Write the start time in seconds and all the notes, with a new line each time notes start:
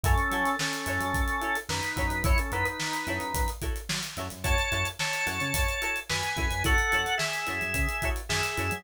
0.04 F#2 C#4 E4 F#4 A4 C#5, kick, closed hi-hat
0.18 closed hi-hat
0.31 F#3 E4 F#4 A4 C#5, closed hi-hat
0.46 snare, closed hi-hat
0.59 C#4 A4, snare
0.73 closed hi-hat
0.86 F#2 E4 F#4 A4 C#5, closed hi-hat
1.00 F#2, closed hi-hat
1.14 F#2, kick, closed hi-hat
1.28 closed hi-hat
1.41 E4 F#4 A4 C#5, closed hi-hat
1.55 closed hi-hat
1.69 F#2 D#4 B4, snare
1.83 closed hi-hat
1.96 F#2 E4 F#4 A4 C#5, kick, closed hi-hat
2.10 F#2, closed hi-hat
2.23 F#2 E4 F#4 A4 C#5, kick, closed hi-hat
2.38 C#4 A4, closed hi-hat
2.52 F#2 D#4 E4 F#4 A4 B4 C#5, closed hi-hat
2.65 D#4 B4, closed hi-hat
2.80 snare
2.93 closed hi-hat
3.07 F#2 E4 F#4 A4 C#5, snare, closed hi-hat
3.20 F#2, closed hi-hat
3.34 F#2, kick, closed hi-hat
3.48 closed hi-hat
3.62 E4 F#4 A4 C#5, kick, closed hi-hat
3.76 closed hi-hat
3.89 F#3, snare
4.03 snare, closed hi-hat
4.17 F#2 E4 F#4 A4 C#5, snare, closed hi-hat
4.30 F#2, closed hi-hat
4.44 F#2 E4 F#4 A4 C#5 A5, kick, closed hi-hat
4.58 snare, closed hi-hat
4.72 F#2 E4 F#4 A4 C#5, closed hi-hat
4.85 closed hi-hat
4.99 C#5 A5, snare
5.13 closed hi-hat
5.26 F#2 E4 F#4 A4 C#5, snare, closed hi-hat
5.40 C#3, closed hi-hat
5.54 F#2, kick, closed hi-hat
5.69 closed hi-hat
5.82 E4 F#4 A4 C#5, closed hi-hat
5.96 closed hi-hat
6.10 F#2 B4 G#5, snare
6.23 closed hi-hat
6.36 F#2 E4 F#4 A4 C#5, kick, closed hi-hat
6.50 F#2, snare, closed hi-hat
6.64 F#2 E4 F#4 A4 C#5 F#5, kick, closed hi-hat
6.78 closed hi-hat
6.92 F#2 E4 F#4 A4 C#5, closed hi-hat
7.06 closed hi-hat
7.18 G#4 E5, snare
7.33 closed hi-hat
7.47 F#2 E4 F#4 A4 C#5, closed hi-hat
7.61 F#2, closed hi-hat
7.74 C#3, kick, closed hi-hat
7.89 closed hi-hat
8.02 E4 F#4 A4 C#5, kick, closed hi-hat
8.16 closed hi-hat
8.29 F#2 G#4 E5, snare
8.43 closed hi-hat
8.57 F#2 E4 F#4 A4 C#5, closed hi-hat
8.71 F#3, closed hi-hat